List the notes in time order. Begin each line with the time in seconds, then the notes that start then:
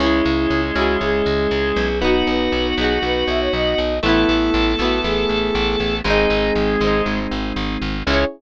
0.00 C#2 G#3 C#4 E4 G#4
0.06 G#4
0.25 C#2
0.50 C#2
0.74 C#2 C#4 F#4
0.78 E4 G#4
1.01 C#2 C#4 E4 G#4
1.26 C#2
1.51 C#2
1.76 B1
2.00 B3 D#4 F#4
2.05 D#4 F#4
2.26 B1 B4
2.52 B1
2.77 B1 B3 D#4 G#4
2.84 F#4
3.02 B1 B3 D#4 F#4 B4
3.28 B1 E5
3.40 C#5
3.53 B1 D#5
3.78 B1
4.03 A1 A3 B3 E4 A4
4.09 E4
4.29 A1
4.54 A1
4.78 A1 A3 B3 F#4
4.85 E4
5.04 A1 A3 B3 E4 G#4
5.29 A1
5.55 A1
5.80 A1
6.04 G#1 G#3 C4 D#4 G#4
6.10 D#4
6.30 G#1
6.55 G#1 G#3
6.80 G#1 G#3 C4
6.87 D#4
7.06 G#1 G#3 C4 D#4
7.31 G#1
7.56 G#1
7.82 G#1
8.06 C#2 C#4 E4 G#4 C#5
8.13 G#4